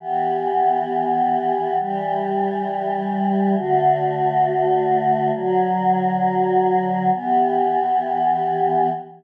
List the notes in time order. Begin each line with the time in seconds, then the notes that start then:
0.00 E3 B3 G4
1.79 E3 G3 G4
3.55 D3 A3 F#4
5.33 D3 F#3 F#4
7.13 E3 B3 G4